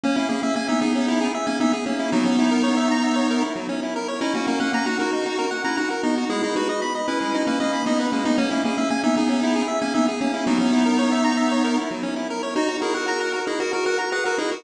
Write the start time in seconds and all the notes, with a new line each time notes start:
0.03 A#3 C#4
0.16 A#3 C#4 E4
0.29 A#3 C#4 G#4
0.43 A#3 C#4 E5
0.56 A#3 C#4 G#5
0.68 B3 D#4 E5
0.81 B3 D#4 G#4
0.95 C#4
1.08 E4
1.21 G#4
1.35 E5
1.47 A#3 C#4 G#5
1.60 B3 D#4 E5
1.73 G#4
1.86 A#3 C#4
1.99 E4
2.12 F#3 B3 D#4
2.25 C#4
2.39 E4
2.51 A#4
2.63 C#5
2.77 E5
2.91 A#5
3.03 E5
3.16 C#5
3.30 A#4
3.42 E4
3.56 F#3
3.69 C#4
3.83 E4
3.96 A#4
4.08 C#5
4.21 C#4 D#4 E4
4.34 A#3 C#4 F#4
4.47 A#3 C#4 A#4
4.60 A#3 C#4 F#5
4.73 A#3 C#4 A#5
4.86 D#4 F#4 F#5
4.99 D#4 F#4 A#4
5.13 D#4
5.26 F#4
5.39 A#4
5.51 F#5
5.64 C#4 E4 A#5
5.77 D#4 F#4 F#5
5.90 A#4
6.03 B3 D#4
6.17 F#4
6.30 G#3 E4 G#4
6.43 D#4 E4 G#4
6.56 D#4 F#4 B4
6.69 D#5
6.82 B5
6.95 D#5
7.08 C#4 E4 B4
7.21 G#3
7.34 D#4
7.47 A#3 C#4 B4
7.60 A#3 C#4 D#5
7.73 B5
7.86 B3 D#4 D#5
8.00 B4
8.12 G#3 A#3 C#4
8.25 B3 D#4
8.38 A#3 C#4
8.51 A#3 C#4 E4
8.64 A#3 C#4 G#4
8.77 A#3 C#4 E5
8.90 A#3 C#4 G#5
9.03 B3 D#4 E5
9.17 B3 D#4 G#4
9.29 C#4
9.43 E4
9.56 G#4
9.68 E5
9.81 A#3 C#4 G#5
9.94 B3 D#4 E5
10.08 G#4
10.21 A#3 C#4
10.34 E4
10.47 F#3 B3 D#4
10.61 C#4
10.72 E4
10.86 A#4
10.99 C#5
11.12 E5
11.24 A#5
11.37 E5
11.51 C#5
11.64 A#4
11.78 E4
11.91 F#3
12.03 C#4
12.16 E4
12.30 A#4
12.43 C#5
12.56 D#4 F#4
12.68 F#4
12.82 E4 G#4 A#4
12.94 F#4 A#4 F#5
13.08 A#5
13.21 F#5
13.33 A#4
13.47 D#4 E4 G#4
13.60 F#4 A#4
13.73 F#4 A#4
13.86 F#4 A#4 F#5
13.98 A#5
14.12 G#4 B4 F#5
14.25 F#4 A#4
14.38 D#4 E4 G#4
14.51 F#4 A#4